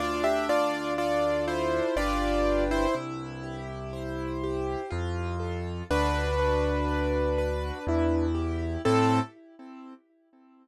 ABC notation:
X:1
M:3/4
L:1/16
Q:1/4=61
K:Am
V:1 name="Acoustic Grand Piano"
[Fd] [Ge] [Fd]2 [Fd]2 [Ec]2 [Fd]3 [Ec] | z12 | [DB]10 z2 | A4 z8 |]
V:2 name="Acoustic Grand Piano"
D2 F2 A2 F2 [DGB]4 | E2 G2 c2 G2 F2 A2 | ^F2 B2 d2 B2 E2 G2 | [CEA]4 z8 |]
V:3 name="Acoustic Grand Piano" clef=bass
D,,8 G,,,4 | C,,8 F,,4 | D,,8 E,,4 | A,,4 z8 |]